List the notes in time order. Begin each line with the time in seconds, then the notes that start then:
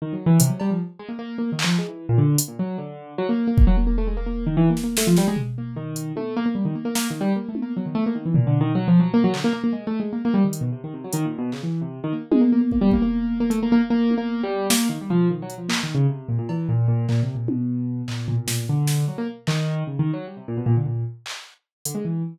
0.02 D#3
0.13 F#3
0.26 E3
0.40 C3, closed hi-hat
0.50 F#3
0.60 G3, cowbell
0.71 F3
0.99 G#3
1.09 A#3
1.19 A#3
1.38 A#3
1.52 D#3
1.59 clap
1.64 F3
1.78 G#3
1.88 E3
2.09 A#2
2.18 D3
2.38 closed hi-hat
2.48 A#2
2.59 F#3
2.78 D3
3.18 F#3
3.29 A#3
3.47 A#3
3.58 kick
3.67 F#3
3.77 A#3
3.87 A#3
3.98 A3
4.07 G#3
4.17 A#3
4.26 A#3
4.47 D#3
4.57 E3
4.70 A#3
4.77 snare
4.84 A#3
4.97 A3, snare
5.07 F3
5.17 G3, snare
5.28 G#3
5.36 floor tom
5.58 A#3
5.76 D#3
5.96 closed hi-hat
6.16 A3, high tom
6.37 A#3
6.46 A#3
6.55 G3
6.65 D#3
6.75 A#3
6.85 A#3
6.95 A#3, snare
7.10 D#3
7.21 G3
7.36 A#3
7.49 A3
7.55 high tom
7.62 A#3
7.77 F#3
7.86 D#3
7.95 A3
8.06 A#3
8.15 D#3
8.26 E3
8.34 A#2, floor tom
8.47 D3
8.61 D#3
8.75 F#3
8.88 F3
9.00 F#3
9.14 A#3
9.24 F#3
9.33 D3, clap
9.44 A#3
9.53 A#3
9.64 A#3
9.73 G#3
9.87 A3
10.00 G#3
10.13 A#3
10.25 A#3
10.34 G3
10.44 D#3
10.53 closed hi-hat
10.61 B2
10.72 C3
10.84 D#3
10.94 C3
11.04 F#3
11.13 D#3, closed hi-hat
11.25 A#2
11.38 B2
11.52 C#3, clap
11.63 E3
11.82 C3
12.04 D#3
12.13 A#3
12.31 G#3, high tom
12.41 A#3
12.52 A#3
12.61 A#3
12.72 A#3, kick
12.81 G3
12.91 A#3, kick
13.02 A#3
13.40 A#3
13.50 A3, closed hi-hat
13.63 A#3
13.72 A#3
13.90 A#3
14.11 high tom
14.18 A#3
14.43 G3
14.70 A#3, snare
14.89 D#3
15.01 G3
15.10 F3, floor tom
15.30 D#3
15.42 F#3
15.50 closed hi-hat
15.58 F3
15.69 A#3, clap
15.83 D#3
15.95 C#3
16.09 C3
16.28 A#2
16.39 A#2
16.49 E3, cowbell
16.69 A#2
16.88 A#2
17.09 A#2, clap
17.23 C3
17.35 A#2
17.48 B2, high tom
18.08 A#2, clap
18.28 A#2, floor tom
18.37 A#2
18.47 A#2, snare
18.69 D3
18.87 snare
19.08 F#3
19.18 A#3
19.47 D#3, clap
19.87 C#3
19.99 D#3
20.13 F#3
20.27 G3
20.37 C3
20.48 A#2
20.57 B2
20.66 A#2
20.77 D3
20.86 A#2
21.26 clap
21.85 D3, closed hi-hat
21.95 G#3
22.05 E3